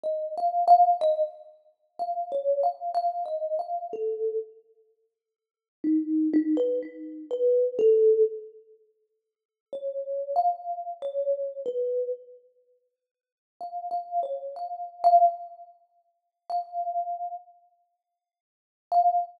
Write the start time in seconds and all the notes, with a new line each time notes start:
0.03 D#5
0.38 F5
0.68 F5
1.01 D#5
1.99 F5
2.32 C#5
2.63 F5
2.95 F5
3.26 D#5
3.59 F5
3.93 A4
5.84 D#4
6.33 D#4
6.57 B4
6.82 D#4
7.31 B4
7.79 A4
9.73 C#5
10.36 F5
11.02 C#5
11.66 B4
13.61 F5
13.91 F5
14.23 C#5
14.56 F5
15.04 F5
16.50 F5
18.92 F5